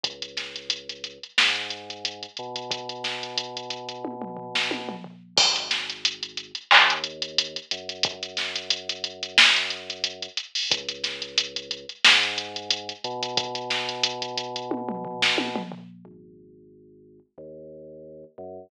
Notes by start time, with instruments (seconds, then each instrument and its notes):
0.03 synth bass 2 C#2, kick, closed hi-hat
0.22 closed hi-hat
0.37 snare, closed hi-hat
0.56 closed hi-hat
0.70 closed hi-hat
0.89 closed hi-hat
1.04 closed hi-hat
1.23 closed hi-hat
1.38 synth bass 2 G#2, snare
1.56 closed hi-hat
1.70 closed hi-hat
1.90 closed hi-hat
2.05 closed hi-hat
2.23 closed hi-hat
2.37 synth bass 2 B2, closed hi-hat
2.56 closed hi-hat
2.71 kick, closed hi-hat
2.89 closed hi-hat
3.04 snare, closed hi-hat
3.23 closed hi-hat
3.38 closed hi-hat
3.57 closed hi-hat
3.70 closed hi-hat
3.89 closed hi-hat
4.05 kick, high tom
4.22 mid tom
4.37 floor tom
4.55 snare
4.71 high tom
4.89 mid tom
5.04 floor tom
5.37 synth bass 2 G#1, kick, crash
5.56 closed hi-hat
5.71 snare, closed hi-hat
5.90 closed hi-hat
6.05 closed hi-hat
6.23 closed hi-hat
6.37 closed hi-hat
6.55 closed hi-hat
6.71 synth bass 2 D#2, clap
6.90 closed hi-hat
7.04 closed hi-hat
7.22 closed hi-hat
7.38 closed hi-hat
7.56 closed hi-hat
7.71 synth bass 2 F#2, closed hi-hat
7.89 closed hi-hat
8.03 kick, closed hi-hat
8.23 closed hi-hat
8.37 snare, closed hi-hat
8.56 closed hi-hat
8.70 closed hi-hat
8.89 closed hi-hat
9.04 closed hi-hat
9.23 closed hi-hat
9.38 snare
9.56 closed hi-hat
9.70 closed hi-hat
9.90 closed hi-hat
10.04 closed hi-hat
10.22 closed hi-hat
10.37 closed hi-hat
10.55 open hi-hat
10.70 synth bass 2 C#2, kick, closed hi-hat
10.89 closed hi-hat
11.04 snare, closed hi-hat
11.22 closed hi-hat
11.38 closed hi-hat
11.56 closed hi-hat
11.71 closed hi-hat
11.89 closed hi-hat
12.05 synth bass 2 G#2, snare
12.23 closed hi-hat
12.38 closed hi-hat
12.56 closed hi-hat
12.71 closed hi-hat
12.89 closed hi-hat
13.04 synth bass 2 B2, closed hi-hat
13.23 closed hi-hat
13.37 kick, closed hi-hat
13.55 closed hi-hat
13.70 snare, closed hi-hat
13.89 closed hi-hat
14.03 closed hi-hat
14.22 closed hi-hat
14.38 closed hi-hat
14.56 closed hi-hat
14.71 kick, high tom
14.89 mid tom
15.05 floor tom
15.22 snare
15.38 high tom
15.56 mid tom
15.72 floor tom
16.05 synth bass 2 G#1
17.38 synth bass 2 D#2
18.38 synth bass 2 F#2